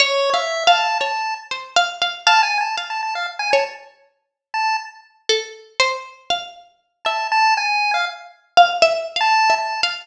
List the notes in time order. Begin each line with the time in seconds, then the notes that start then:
0.00 C#5
0.34 E5 F5
0.67 F5 A5
1.00 C#5 A5
1.51 C5
1.76 F5
2.02 F5
2.27 F5 A5
2.43 G#5
2.61 A5
2.78 F5
2.90 A5
3.03 A5
3.15 F5
3.39 G#5
3.52 C#5 A5
4.54 A5
5.29 A4
5.80 C5
6.30 F5
7.05 E5 A5
7.32 A5
7.57 G#5
7.94 F5
8.57 F5
8.82 E5
9.16 F5
9.21 A5
9.50 E5
9.59 A5
9.83 F5